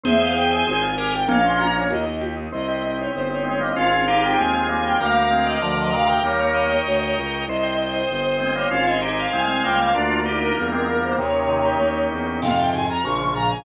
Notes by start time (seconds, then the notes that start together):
0.03 E2 C4 G#4 C5 E5, low conga
0.20 E4 F5
0.35 G4 G5
0.51 E4 G#5
0.67 G#1 C4 G#5, high conga
0.82 F4
0.98 G4 G#4 A#4 G#5
1.13 F4 G5
1.28 A#1 A#3 C#4 F5, low conga
1.44 C#4 C6
1.58 F4 A#5, high conga
1.75 C#4 C#5
1.90 D#2 A#3 D#5, high conga
2.06 D#4
2.21 G4, high conga
2.37 D#4
2.52 C2 C4 D#5
2.68 G4
2.83 C4
2.98 D#4 C#5
3.12 G1 C4 C5
3.29 G4 C#5
3.43 G#3 C4 D#4 C#5
3.60 G3 A#3 C4 D#5
3.75 G#1 C4 C#4 F4 F5
3.91 G#4 F5
4.07 C4 D#4 G4 F5
4.23 F4 G5
4.38 D#2 G#3 C4 G#5
4.53 G#3 C4 G#4
4.69 G3 A#3 F4 G#5
4.83 C4 G5
4.99 D2 G3 A#3 A#4 F5
5.16 F5
5.31 G#3 C4 A#4
5.45 D5 D#5
5.61 D2 D3 F3 A#4 D5
5.77 D3 F3 D#5 F5
5.92 C3 D#3 D5 F5
6.07 A#4 G5
6.23 D#2 G3 A#3 A#4 C#5
6.40 C#5
6.54 D#5
6.69 G5
6.86 D2 A#4
7.01 C#5
7.16 C#2 D#5
7.31 G5
7.47 C2 C5 D#5
7.63 G5
7.77 C5
7.93 C5 D#5
8.08 G1 C5
8.23 C5 G5
8.39 G#3 C4 C5 D#5
8.55 G3 A#3 C5 C#5
8.70 G#1 C#4 F4 C5 F5
8.86 D#5 G#5
9.01 D#4 G4 C5 D#5
9.18 F5
9.31 C2 G#3 C4 C5 G#5
9.47 G#3 C4 G#5
9.63 C#2 G3 A#3 F5 G5
9.80 C5 F5
9.95 D2 A#3 D4 F4 D5
10.09 F4
10.26 A#3 D#4 G4
10.41 D4 A#4
10.55 E2 G3 A#3 A#4
10.72 G#3 C4 F4 A#4
10.87 G3 A#3 D4 A#4
11.02 A#3 C5
11.18 D#2 C3 D#3 A#3 C#5
11.33 C#4
11.49 D#4
11.65 G4
11.80 D#2 A#3
11.96 C#4
12.11 E2 D#4
12.26 G4
12.41 F2 G#2 C3 C4 F5, crash, low conga
12.57 G#2 C3 F4 G5
12.73 G#2 C3 G#4 G#5, high conga
12.89 F4 A#5
13.04 A#1 C#3 F3 A#3 C#6, high conga
13.18 C#4
13.34 A#2 C#3 F4 A#5
13.49 C#4 G#5